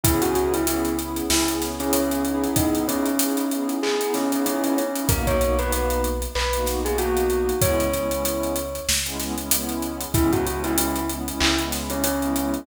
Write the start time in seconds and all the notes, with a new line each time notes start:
0.04 C#2 B3 C#4 E4 G#4, kick, closed hi-hat
0.22 F#4, closed hi-hat
0.35 F#4, closed hi-hat
0.53 E4, closed hi-hat
0.67 B3 C#4 E4 G#4, closed hi-hat
0.85 closed hi-hat
0.99 B3 C#4 E4 G#4, closed hi-hat
1.16 closed hi-hat
1.30 C#2 B3 C#4 E4 G#4, snare
1.48 B3 C#4 E4 G#4, closed hi-hat
1.62 snare, closed hi-hat
1.79 B3 C#4 E4 G#4, snare, closed hi-hat
1.93 C#4, closed hi-hat
2.11 closed hi-hat
2.25 B3 D#4 E4 G#4, closed hi-hat
2.44 closed hi-hat
2.56 D#4, kick, closed hi-hat
2.75 closed hi-hat
2.88 C#4, closed hi-hat
3.06 closed hi-hat
3.19 B3 D#4 E4 G#4, closed hi-hat
3.37 closed hi-hat
3.51 B3 D#4 E4 G#4, closed hi-hat
3.69 closed hi-hat
3.83 B3 D#4 E4 G#4, clap
4.01 B3 D#4 E4 G#4, closed hi-hat
4.14 C#4, snare, closed hi-hat
4.32 B3 C#4 D#4 E4 G#4, closed hi-hat
4.46 C#4, closed hi-hat
4.64 C#4, closed hi-hat
4.78 C#4, closed hi-hat
4.96 B3 D#4 E4 G#4, closed hi-hat
5.09 B1 A#3 B3 D#4 F#4 A#4, kick, closed hi-hat
5.27 C#5, kick, closed hi-hat
5.41 A#3 B3 D#4 F#4 C#5, closed hi-hat
5.59 A#3 B3 D#4 F#4 B4, closed hi-hat
5.72 B4, closed hi-hat
5.90 closed hi-hat
6.04 closed hi-hat
6.22 closed hi-hat
6.35 B1 B4, clap
6.53 A#3 B3 D#4 F#4, closed hi-hat
6.66 A#3 B3 D#4 F#4, snare, closed hi-hat
6.85 A#3 B3 D#4 F#4 G#4, closed hi-hat
6.98 A#3 B3 D#4 F#4, closed hi-hat
7.17 closed hi-hat
7.30 closed hi-hat
7.49 closed hi-hat
7.61 C#2 G#3 B3 C#4 E4 C#5, kick, closed hi-hat
7.80 closed hi-hat
7.93 G#3 B3 C#4 E4, closed hi-hat
8.11 G#3 B3 C#4 E4, closed hi-hat
8.25 closed hi-hat
8.43 closed hi-hat
8.56 closed hi-hat
8.75 closed hi-hat
8.88 C#2, snare
9.06 G#3 B3 C#4 E4, closed hi-hat
9.20 G#3 B3 C#4 E4, snare, closed hi-hat
9.38 G#3 B3 C#4 E4, closed hi-hat
9.51 G#3 B3 C#4 E4, closed hi-hat
9.69 closed hi-hat
9.82 closed hi-hat
10.01 closed hi-hat
10.14 C#2 G#3 B3 C#4 E4, kick, closed hi-hat
10.32 F#4, kick, closed hi-hat
10.46 G#3 B3 C#4 E4 F#4, closed hi-hat
10.64 E4, closed hi-hat
10.78 E4, closed hi-hat
10.96 closed hi-hat
11.09 G#3 B3 C#4 E4, closed hi-hat
11.27 G#3 B3 C#4 E4, closed hi-hat
11.41 C#2 E4, clap
11.59 G#3 B3 C#4 E4, closed hi-hat
11.72 snare, closed hi-hat
11.90 C#4, closed hi-hat
12.04 C#4, closed hi-hat
12.22 G#3 B3 C#4 E4, closed hi-hat
12.36 G#3 B3 C#4 E4, closed hi-hat
12.54 closed hi-hat